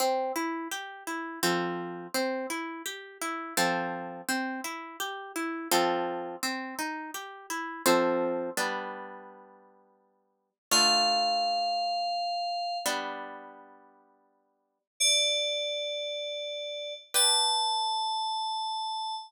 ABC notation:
X:1
M:3/4
L:1/8
Q:1/4=84
K:Cmix
V:1 name="Electric Piano 2"
z6 | z6 | z6 | z6 |
[K:Gmix] z6 | f6 | z6 | d6 |
a6 |]
V:2 name="Orchestral Harp"
C E G E [F,CA]2 | C E G E [F,CA]2 | C E G E [F,CA]2 | C _E G =E [F,CA]2 |
[K:Gmix] [G,B,D]6 | [D,A,F]6 | [G,B,D]6 | z6 |
[GBd]6 |]